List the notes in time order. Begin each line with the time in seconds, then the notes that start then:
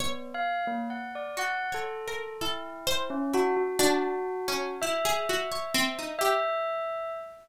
0.00 B3 C#5
0.34 F5
0.67 A#3
0.90 F#5
1.15 D5
1.37 F#4 F#5
1.72 A4 C#5
2.08 A#4
2.41 E4 A4
2.87 C5
3.10 C#4
3.33 E4 F#4
3.57 F#4
3.79 D4 F#4
4.48 C#4
4.82 E4 E5
5.05 G#4
5.29 F#4
5.52 C#5
5.74 C4
5.99 D#4
6.19 G4 E5